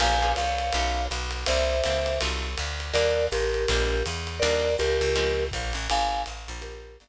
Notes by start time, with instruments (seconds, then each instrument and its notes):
0.00 electric bass (finger) A#1, acoustic guitar (steel) A#3 C#4 F4 G#4, vibraphone F5 G#5, crash, ride
0.22 acoustic guitar (steel) A#3 C#4 F4 G#4
0.36 electric bass (finger) C2, vibraphone C#5 F5, hi-hat pedal, ride
0.58 ride
0.72 electric bass (finger) B1, acoustic guitar (steel) A3 B3 C#4 D#4, ride
1.11 electric bass (finger) B1, hi-hat pedal, ride
1.31 ride
1.46 electric bass (finger) C2, acoustic guitar (steel) G3 A#3 C4 E4, vibraphone C5 E5, ride
1.84 electric bass (finger) C#2, acoustic guitar (steel) G3 A#3 C4 E4, hi-hat pedal, ride
2.06 ride
2.21 electric bass (finger) C2, acoustic guitar (steel) F#3 A3 D#4 F4, ride
2.58 electric bass (finger) D2, hi-hat pedal, ride
2.80 ride
2.93 electric bass (finger) D#2, acoustic guitar (steel) G3 A#3 D4 D#4, vibraphone A#4 D5, ride
3.31 electric bass (finger) A1, vibraphone G4 A#4, hi-hat pedal, ride
3.54 ride
3.68 electric bass (finger) A#1, acoustic guitar (steel) G3 G#3 A#3 D4, kick, ride
4.06 electric bass (finger) E2, hi-hat pedal, ride
4.27 ride
4.39 electric bass (finger) D#2, acoustic guitar (steel) G3 A#3 D4 D#4, vibraphone A#4 D5, ride
4.78 electric bass (finger) C#2, vibraphone G4 A#4, hi-hat pedal, ride
5.01 electric bass (finger) C#2, ride
5.16 acoustic guitar (steel) F3 G#3 C4 C#4, ride
5.51 electric bass (finger) A#1, kick, hi-hat pedal, ride
5.73 electric bass (finger) A1, ride
5.90 electric bass (finger) G#1, vibraphone F5 G#5, ride
6.26 electric bass (finger) A1, hi-hat pedal, ride
6.48 electric bass (finger) A#1, ride
6.62 vibraphone G4 A#4, ride
7.00 electric bass (finger) G1, hi-hat pedal, ride